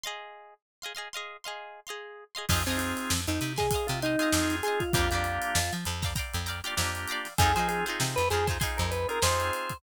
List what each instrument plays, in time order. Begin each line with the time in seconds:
0.04 acoustic guitar (steel) G#4 D#5 F5 C6
0.82 acoustic guitar (steel) G#4 D#5 F5 C6
0.95 acoustic guitar (steel) G#4 D#5 F5 C6
1.13 acoustic guitar (steel) G#4 D#5 F5 C6
1.44 acoustic guitar (steel) G#4 D#5 F5 C6
1.87 acoustic guitar (steel) G#4 D#5 F5 C6
2.35 acoustic guitar (steel) G#4 D#5 F5 C6
2.49 electric bass (finger) F2, drawbar organ C4 D#4 F4 G#4, acoustic guitar (steel) F5 G#5 C6, kick, crash
2.53 acoustic guitar (steel) D#5
2.66 electric bass (finger) F2, drawbar organ C4 D#4 F4 G#4, acoustic guitar (steel) F5 G#5 C6, closed hi-hat
2.70 acoustic guitar (steel) D#5
2.78 drawbar organ C4, closed hi-hat
2.97 closed hi-hat
3.10 electric bass (finger) F2, snare
3.27 electric bass (finger) F2, drawbar organ D#4, closed hi-hat
3.40 electric bass (finger) C3, snare, closed hi-hat
3.56 drawbar organ G#4, acoustic guitar (steel) D#5 F5 G#5 C6, kick, snare, closed hi-hat
3.71 acoustic guitar (steel) F5 G#5 C6, kick, closed hi-hat
3.75 acoustic guitar (steel) D#5
3.87 electric bass (finger) C3, drawbar organ F4, snare, closed hi-hat
4.02 drawbar organ D#4, acoustic guitar (steel) D#5 F5 G#5 C6, closed hi-hat
4.19 drawbar organ C4 D#4 F4 G#4, acoustic guitar (steel) D#5 F5 G#5 C6, snare, closed hi-hat
4.32 electric bass (finger) F2, drawbar organ C4 D#4 F4 G#4, snare
4.50 snare, closed hi-hat
4.63 drawbar organ G#4, acoustic guitar (steel) F5 G#5 C6, closed hi-hat
4.68 acoustic guitar (steel) D#5
4.80 drawbar organ F4, kick, closed hi-hat
4.93 electric bass (finger) F2, drawbar organ A#3 D4 F4 G4, acoustic guitar (steel) G5 A#5, kick, closed hi-hat
4.97 acoustic guitar (steel) D5 F5
5.11 electric bass (finger) F2, drawbar organ A#3 D4 F4 G4, acoustic guitar (steel) F5 G5 A#5, closed hi-hat
5.15 acoustic guitar (steel) D5
5.24 closed hi-hat
5.42 closed hi-hat
5.55 electric bass (finger) F2, snare
5.73 electric bass (finger) F3, closed hi-hat
5.85 electric bass (finger) F2, closed hi-hat
6.02 acoustic guitar (steel) D5 F5 G5 A#5, kick, snare, closed hi-hat
6.16 acoustic guitar (steel) D5 F5 G5 A#5, kick, closed hi-hat
6.34 electric bass (finger) F2, closed hi-hat
6.46 acoustic guitar (steel) D5 F5 G5 A#5, closed hi-hat
6.64 drawbar organ A#3 D4 F4 G4, acoustic guitar (steel) D5 F5 G5 A#5, closed hi-hat
6.77 electric bass (finger) F2, drawbar organ A#3 D4 F4 G4, snare
6.95 closed hi-hat
7.08 acoustic guitar (steel) F5 G5 A#5, closed hi-hat
7.12 acoustic guitar (steel) D5
7.25 snare, closed hi-hat
7.38 electric bass (finger) F2, drawbar organ C4 D#4 F4 G#4, acoustic guitar (steel) D#4 F4 G#4 C5, kick, closed hi-hat
7.55 electric bass (finger) F3, drawbar organ C4 D#4 F4 G#4, acoustic guitar (steel) F4 G#4 C5, snare, closed hi-hat
7.59 acoustic guitar (steel) D#4
7.68 drawbar organ G#4, closed hi-hat
7.86 acoustic guitar (steel) D#4 F4 G#4 C5, closed hi-hat
8.00 electric bass (finger) C3, snare
8.16 electric bass (finger) F2, drawbar organ B4, closed hi-hat
8.30 electric bass (finger) F2, acoustic guitar (steel) D#4 F4 G#4 C5, drawbar organ G#4, snare, closed hi-hat
8.47 acoustic guitar (steel) D#4 F4 G#4 C5, kick, snare, closed hi-hat
8.60 acoustic guitar (steel) D#4 F4 G#4 C5, kick, closed hi-hat
8.77 electric bass (finger) F2, drawbar organ A#4, closed hi-hat
8.91 drawbar organ B4, closed hi-hat
9.09 drawbar organ C4 D#4 F4 G#4 A#4, closed hi-hat
9.22 electric bass (finger) F2, drawbar organ C4 D#4 F4 G#4 C5, acoustic guitar (steel) D#4 F4 G#4 C5, snare
9.40 closed hi-hat
9.53 closed hi-hat
9.70 kick, closed hi-hat